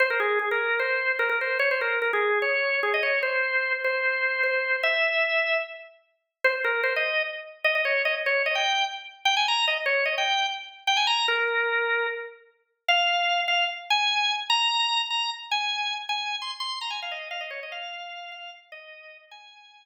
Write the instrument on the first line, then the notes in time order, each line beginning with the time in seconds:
drawbar organ
0.00 C5
0.10 A#4
0.20 G#4
0.39 G#4
0.51 A#4
0.79 C5
1.19 A#4
1.29 A#4
1.41 C5
1.59 C#5
1.71 C5
1.81 A#4
2.02 A#4
2.13 G#4
2.42 C#5
2.83 G#4
2.94 D#5
3.03 C#5
3.23 C5
3.84 C5
4.43 C5
4.83 E5
6.44 C5
6.64 A#4
6.83 C5
6.96 D#5
7.64 D#5
7.75 D#5
7.85 C#5
8.05 D#5
8.26 C#5
8.46 D#5
8.55 G5
9.25 G5
9.37 G#5
9.48 A#5
9.68 D#5
9.86 C#5
10.05 D#5
10.18 G5
10.87 G5
10.97 G#5
11.07 A#5
11.28 A#4
12.88 F5
13.48 F5
13.90 G#5
14.50 A#5
15.10 A#5
15.51 G#5
16.09 G#5
16.42 C6
16.60 C6
16.81 A#5
16.90 G#5
17.02 F5
17.11 D#5
17.31 F5
17.41 D#5
17.51 C#5
17.63 D#5
17.72 F5
18.32 F5
18.72 D#5
19.31 G#5